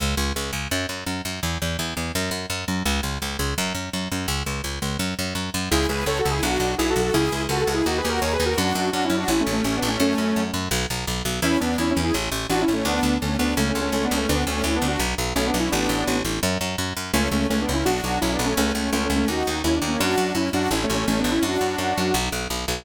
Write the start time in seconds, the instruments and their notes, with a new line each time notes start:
0.00 electric bass (finger) C#2
0.17 electric bass (finger) C#2
0.36 electric bass (finger) C#2
0.53 electric bass (finger) C#2
0.71 electric bass (finger) F#2
0.89 electric bass (finger) F#2
1.06 electric bass (finger) F#2
1.25 electric bass (finger) F#2
1.43 electric bass (finger) E2
1.62 electric bass (finger) E2
1.79 electric bass (finger) E2
1.97 electric bass (finger) E2
2.15 electric bass (finger) F#2
2.31 electric bass (finger) F#2
2.50 electric bass (finger) F#2
2.68 electric bass (finger) F#2
2.85 electric bass (finger) C#2
3.03 electric bass (finger) C#2
3.22 electric bass (finger) C#2
3.39 electric bass (finger) C#2
3.58 electric bass (finger) F#2
3.75 electric bass (finger) F#2
3.93 electric bass (finger) F#2
4.12 electric bass (finger) F#2
4.28 electric bass (finger) C#2
4.46 electric bass (finger) C#2
4.64 electric bass (finger) C#2
4.82 electric bass (finger) C#2
4.99 electric bass (finger) F#2
5.19 electric bass (finger) F#2
5.35 electric bass (finger) F#2
5.54 electric bass (finger) F#2
5.71 electric bass (finger) C#2, lead 2 (sawtooth) E4 G#4
5.89 electric bass (finger) C#2, lead 2 (sawtooth) G#4 B4
6.06 electric bass (finger) C#2, lead 2 (sawtooth) A4 C#5
6.19 lead 2 (sawtooth) F#4 A4
6.25 electric bass (finger) C#2
6.31 lead 2 (sawtooth) E4 G#4
6.43 electric bass (finger) B1, lead 2 (sawtooth) D4 F#4
6.60 electric bass (finger) B1
6.78 electric bass (finger) B1, lead 2 (sawtooth) E4 G#4
6.90 lead 2 (sawtooth) F#4 A4
6.96 electric bass (finger) B1
7.02 lead 2 (sawtooth) F#4 A4
7.14 electric bass (finger) C#2, lead 2 (sawtooth) E4 G#4
7.32 electric bass (finger) C#2
7.49 electric bass (finger) C#2, lead 2 (sawtooth) F#4 A4
7.61 lead 2 (sawtooth) F#4 A4
7.67 electric bass (finger) C#2
7.74 lead 2 (sawtooth) E4 G#4
7.86 electric bass (finger) D#2, lead 2 (sawtooth) D#4 F#4
7.98 lead 2 (sawtooth) G#4 B4
8.05 electric bass (finger) D#2
8.09 lead 2 (sawtooth) F#4 A#4
8.21 electric bass (finger) D#2, lead 2 (sawtooth) A#4 C#5
8.33 lead 2 (sawtooth) G#4 B4
8.40 electric bass (finger) D#2
8.46 lead 2 (sawtooth) F#4 A#4
8.57 electric bass (finger) F#2, lead 2 (sawtooth) D4 F#4
8.75 electric bass (finger) F#2
8.92 electric bass (finger) F#2, lead 2 (sawtooth) D4 F#4
9.05 lead 2 (sawtooth) C#4 E4
9.10 electric bass (finger) F#2
9.17 lead 2 (sawtooth) D4 F#4
9.28 electric bass (finger) A1, lead 2 (sawtooth) C#4 E4
9.40 lead 2 (sawtooth) A3 C#4
9.47 electric bass (finger) A1
9.52 lead 2 (sawtooth) A3 C#4
9.64 electric bass (finger) A1, lead 2 (sawtooth) A3 C#4
9.77 lead 2 (sawtooth) B3 D4
9.82 electric bass (finger) A1
9.88 lead 2 (sawtooth) A3 C#4
10.00 electric bass (finger) F#2, lead 2 (sawtooth) A3 C#4
10.18 electric bass (finger) F#2
10.36 electric bass (finger) F#2
10.54 electric bass (finger) F#2
10.71 electric bass (finger) B1
10.90 electric bass (finger) B1
11.07 electric bass (finger) B1
11.25 electric bass (finger) B1
11.42 electric bass (finger) E2, lead 2 (sawtooth) C#4 E4
11.60 electric bass (finger) E2, lead 2 (sawtooth) B3 D4
11.78 electric bass (finger) E2, lead 2 (sawtooth) C#4 E4
11.91 lead 2 (sawtooth) C#4 E4
11.97 electric bass (finger) E2
12.03 lead 2 (sawtooth) E4 G#4
12.14 electric bass (finger) A1
12.32 electric bass (finger) A1
12.50 electric bass (finger) A1, lead 2 (sawtooth) D4 F#4
12.61 lead 2 (sawtooth) C#4 E4
12.68 electric bass (finger) A1
12.73 lead 2 (sawtooth) A3 C#4
12.85 electric bass (finger) D2, lead 2 (sawtooth) B3 D4
13.03 electric bass (finger) D2
13.22 electric bass (finger) D2, lead 2 (sawtooth) A3 C#4
13.39 electric bass (finger) D2, lead 2 (sawtooth) B3 D4
13.57 electric bass (finger) C#2, lead 2 (sawtooth) A3 C#4
13.69 lead 2 (sawtooth) A3 C#4
13.75 electric bass (finger) C#2
13.81 lead 2 (sawtooth) A3 C#4
13.92 electric bass (finger) C#2, lead 2 (sawtooth) A3 C#4
14.04 lead 2 (sawtooth) B3 D4
14.11 electric bass (finger) C#2
14.17 lead 2 (sawtooth) A3 C#4
14.29 electric bass (finger) D2, lead 2 (sawtooth) B3 D4
14.47 electric bass (finger) D2, lead 2 (sawtooth) A3 C#4
14.64 electric bass (finger) D2, lead 2 (sawtooth) C#4 E4
14.76 lead 2 (sawtooth) B3 D4
14.82 electric bass (finger) D2
14.88 lead 2 (sawtooth) D4 F#4
14.99 electric bass (finger) B1
15.18 electric bass (finger) B1
15.35 electric bass (finger) B1, lead 2 (sawtooth) A3 C#4
15.47 lead 2 (sawtooth) B3 D4
15.54 electric bass (finger) B1
15.60 lead 2 (sawtooth) C#4 E4
15.72 electric bass (finger) A1, lead 2 (sawtooth) B3 D4
15.89 electric bass (finger) A1
16.07 electric bass (finger) A1
16.25 electric bass (finger) A1
16.43 electric bass (finger) F#2
16.61 electric bass (finger) F#2
16.78 electric bass (finger) F#2
16.97 electric bass (finger) F#2
17.14 electric bass (finger) C#2, lead 2 (sawtooth) A3 C#4
17.31 electric bass (finger) C#2, lead 2 (sawtooth) A3 C#4
17.50 electric bass (finger) C#2, lead 2 (sawtooth) A3 C#4
17.62 lead 2 (sawtooth) B3 D4
17.69 electric bass (finger) C#2
17.74 lead 2 (sawtooth) C#4 E4
17.85 electric bass (finger) B1, lead 2 (sawtooth) D4 F#4
18.04 electric bass (finger) B1
18.21 electric bass (finger) B1, lead 2 (sawtooth) C#4 E4
18.33 lead 2 (sawtooth) B3 D4
18.39 electric bass (finger) B1
18.45 lead 2 (sawtooth) A3 C#4
18.57 electric bass (finger) C#2, lead 2 (sawtooth) A3 C#4
18.75 electric bass (finger) C#2, lead 2 (sawtooth) A3 C#4
18.92 electric bass (finger) C#2, lead 2 (sawtooth) A3 C#4
19.05 lead 2 (sawtooth) A3 C#4
19.10 electric bass (finger) C#2
19.16 lead 2 (sawtooth) A3 C#4
19.28 electric bass (finger) D#2, lead 2 (sawtooth) D#4 F#4
19.47 electric bass (finger) D#2
19.64 electric bass (finger) D#2, lead 2 (sawtooth) C#4 E4
19.76 lead 2 (sawtooth) D4
19.82 electric bass (finger) D#2
19.88 lead 2 (sawtooth) A#3 C#4
20.00 electric bass (finger) F#2, lead 2 (sawtooth) D4 F#4
20.18 electric bass (finger) F#2
20.35 electric bass (finger) F#2, lead 2 (sawtooth) C#4 E4
20.53 electric bass (finger) F#2, lead 2 (sawtooth) D4 F#4
20.71 electric bass (finger) A1, lead 2 (sawtooth) C#4 E4
20.83 lead 2 (sawtooth) A3 C#4
20.90 electric bass (finger) A1
20.95 lead 2 (sawtooth) A3 C#4
21.07 electric bass (finger) A1, lead 2 (sawtooth) A3 C#4
21.19 lead 2 (sawtooth) B3 D4
21.24 electric bass (finger) A1
21.31 lead 2 (sawtooth) C#4 E4
21.43 electric bass (finger) F#2, lead 2 (sawtooth) D4 F#4
21.61 electric bass (finger) F#2
21.78 electric bass (finger) F#2
21.98 electric bass (finger) F#2
22.14 electric bass (finger) B1
22.32 electric bass (finger) B1
22.50 electric bass (finger) B1
22.68 electric bass (finger) B1